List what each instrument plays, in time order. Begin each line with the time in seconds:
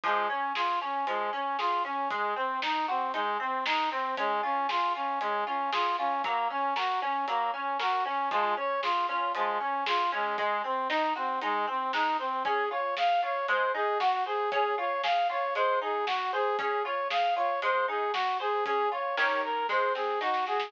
0.04 harpsichord F3, brass section G#3, kick, closed hi-hat
0.29 brass section C#4, harpsichord C#4
0.55 brass section F4, harpsichord G#4, snare
0.81 brass section C#4, harpsichord C#4
1.07 harpsichord F3, brass section G#3, closed hi-hat
1.33 harpsichord C#4, brass section C#4
1.59 brass section F4, harpsichord G#4, snare
1.85 harpsichord C#4, brass section C#4
2.10 brass section G#3, harpsichord G#3, kick, closed hi-hat
2.36 harpsichord C4, brass section C4
2.62 harpsichord D#4, brass section D#4, snare
2.88 brass section C4, harpsichord F#4
3.14 brass section G#3, harpsichord D#4, closed hi-hat
3.40 harpsichord C4, brass section C4
3.66 harpsichord G#3, brass section D#4, snare
3.91 brass section C4, harpsichord C4
4.17 brass section G#3, harpsichord C#4, kick, closed hi-hat
4.43 brass section C#4, harpsichord F4
4.69 brass section F4, harpsichord G#4, snare
4.95 brass section C#4, harpsichord F4
5.20 brass section G#3, harpsichord C#4, closed hi-hat
5.46 brass section C#4, harpsichord F4
5.72 brass section F4, harpsichord G#4, snare
5.98 brass section C#4, harpsichord F4
6.24 harpsichord F#3, brass section A#3, kick, closed hi-hat
6.50 harpsichord C#4, brass section C#4
6.76 brass section F#4, harpsichord A#4, snare
7.02 brass section C#4, harpsichord C#4
7.27 harpsichord F#3, brass section A#3, closed hi-hat
7.54 harpsichord C#4, brass section C#4
7.79 brass section F#4, harpsichord A#4, snare
8.05 harpsichord C#4, brass section C#4
8.31 harpsichord F3, brass section G#3, kick, closed hi-hat
8.57 harpsichord C#4, brass section C#5
8.83 brass section F4, harpsichord G#4, snare
9.09 harpsichord C#4, brass section F4
9.35 harpsichord F3, brass section G#3, closed hi-hat
9.60 brass section C#4, harpsichord C#4
9.86 brass section F4, harpsichord G#4, snare
10.12 brass section G#3, harpsichord C#4
10.38 harpsichord G#3, brass section G#3, kick, closed hi-hat
10.64 harpsichord C4, brass section C4
10.90 brass section D#4, harpsichord D#4, snare
11.16 brass section C4, harpsichord F#4
11.41 brass section G#3, harpsichord D#4, closed hi-hat
11.67 harpsichord C4, brass section C4
11.93 harpsichord G#3, brass section D#4, snare
12.19 harpsichord C4, brass section C4
12.45 harpsichord C#4, brass section G#4, kick, closed hi-hat
12.71 harpsichord F4, brass section C#5
12.97 harpsichord G#4, brass section F5, snare
13.23 harpsichord F4, brass section C#5
13.48 harpsichord G#3, brass section C5, closed hi-hat
13.74 harpsichord D#4, brass section G#4
14.00 brass section F#4, harpsichord F#4, snare
14.26 brass section G#4, harpsichord C5
14.52 harpsichord C#4, brass section G#4, kick, closed hi-hat
14.78 harpsichord F4, brass section C#5
15.03 harpsichord G#4, brass section F5, snare
15.30 harpsichord F4, brass section C#5
15.55 harpsichord G#3, brass section C5, closed hi-hat
15.81 harpsichord D#4, brass section G#4
16.07 harpsichord F#4, brass section F#4, snare
16.33 brass section G#4, harpsichord C5
16.59 harpsichord C#4, brass section G#4, kick, closed hi-hat
16.84 harpsichord F4, brass section C#5
17.10 harpsichord G#4, brass section F5, snare
17.36 harpsichord F4, brass section C#5
17.62 harpsichord G#3, brass section C5, closed hi-hat
17.88 harpsichord D#4, brass section G#4
18.13 brass section F#4, harpsichord F#4, snare
18.40 brass section G#4, harpsichord C5
18.65 harpsichord C#4, brass section G#4, kick, closed hi-hat
18.91 harpsichord F4, brass section C#5
19.17 harpsichord D#3 C#4 G4 A#4, brass section C#5, snare
19.43 brass section A#4
19.69 harpsichord G#3, brass section C5, kick, snare
19.95 harpsichord C4, brass section G#4, snare
20.21 harpsichord D#4, brass section F#4, snare
20.34 snare
20.47 harpsichord F#4, brass section G#4, snare
20.60 snare